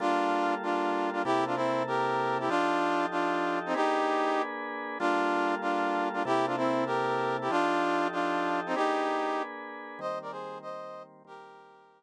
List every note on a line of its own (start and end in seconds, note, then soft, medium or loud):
0.00 1.24 G3 medium
0.00 1.24 A#3 medium
0.00 0.55 D4 loud
0.00 0.55 F4 loud
0.00 1.24 F4 medium
0.00 1.24 A4 medium
0.63 1.10 D4 medium
0.63 1.10 F4 medium
1.13 1.22 D4 medium
1.13 1.22 F4 medium
1.25 2.49 C3 medium
1.25 2.49 A#3 medium
1.25 1.45 E4 loud
1.25 2.49 E4 medium
1.25 1.45 G4 loud
1.25 2.49 A4 medium
1.47 1.56 D4 medium
1.47 1.56 F4 medium
1.56 1.83 C4 medium
1.56 1.83 E4 loud
1.87 2.38 G4 medium
1.87 2.38 A#4 loud
2.40 2.49 E4 medium
2.40 2.49 G4 medium
2.49 3.74 F3 medium
2.49 3.06 D4 loud
2.49 3.74 D#4 medium
2.49 3.06 F4 loud
2.49 3.74 G4 medium
2.49 3.74 A4 medium
3.11 3.59 D4 medium
3.11 3.59 F4 loud
3.66 3.76 C4 medium
3.66 3.75 D#4 loud
3.74 4.98 A#3 medium
3.74 4.98 D4 medium
3.74 4.42 D#4 loud
3.74 4.42 G4 loud
3.74 4.98 G#4 medium
3.74 4.98 B4 medium
4.99 6.24 G3 medium
4.99 6.24 A#3 medium
4.99 5.55 D4 loud
4.99 5.55 F4 loud
4.99 6.24 F4 medium
4.99 6.24 A4 medium
5.62 6.09 D4 medium
5.62 6.09 F4 medium
6.13 6.23 D4 medium
6.13 6.23 F4 medium
6.25 7.49 C3 medium
6.25 7.49 A#3 medium
6.25 7.49 E4 medium
6.25 6.46 E4 loud
6.25 6.46 G4 loud
6.25 7.49 A4 medium
6.47 6.56 D4 medium
6.47 6.56 F4 medium
6.57 6.84 C4 medium
6.57 6.84 E4 loud
6.86 7.37 G4 medium
6.86 7.37 A#4 loud
7.41 7.51 E4 medium
7.41 7.51 G4 medium
7.50 8.74 F3 medium
7.50 8.07 D4 loud
7.50 8.74 D#4 medium
7.50 8.07 F4 loud
7.50 8.74 G4 medium
7.50 8.74 A4 medium
8.12 8.60 D4 medium
8.12 8.60 F4 loud
8.66 8.76 C4 medium
8.66 8.75 D#4 loud
8.75 9.98 A#3 medium
8.75 10.00 D4 medium
8.75 9.42 D#4 loud
8.75 9.42 G4 loud
8.75 10.00 G#4 medium
8.75 10.00 B4 medium
9.99 11.23 D#3 medium
9.99 11.23 G3 medium
9.99 11.23 A#3 medium
9.99 11.23 C4 medium
9.99 10.19 C5 loud
9.99 10.19 D#5 loud
10.22 10.31 A#4 medium
10.22 10.31 D5 loud
10.31 10.58 G#4 medium
10.31 10.58 C5 loud
10.62 11.03 C5 loud
10.62 11.03 D#5 loud
11.25 12.03 D#3 medium
11.25 12.03 G3 medium
11.25 12.03 A#3 medium
11.25 12.03 C4 medium
11.25 12.03 G4 loud
11.25 12.03 A#4 loud